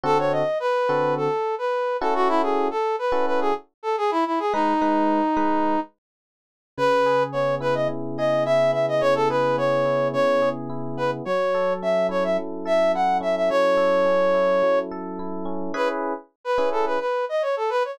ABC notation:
X:1
M:4/4
L:1/16
Q:1/4=107
K:C#m
V:1 name="Brass Section"
A c d2 B4 A3 B3 A F | E G2 A2 B2 B G z2 A G E E G | D10 z6 | B4 c2 B d z2 d2 e2 e d |
c A B2 c4 c3 z3 B z | c4 e2 c e z2 e2 f2 e e | c10 z6 | B z4 B2 A B B2 d c A B c |]
V:2 name="Electric Piano 1"
[=D,=CFA]6 [D,CFA]8 [^CEFA]2- | [CEFA]6 [CEFA]10 | [G,DB]2 [G,DB]4 [G,DB]10 | C,2 G2 B,2 E2 C,2 G2 E2 B,2 |
C,2 G2 B,2 E2 C,2 G2 E2 B,2 | F,2 A2 C2 E2 F,2 A2 E2 C2 | F,2 A2 C2 E2 F,2 A2 E2 C2 | [CEGB]6 [CEGB]10 |]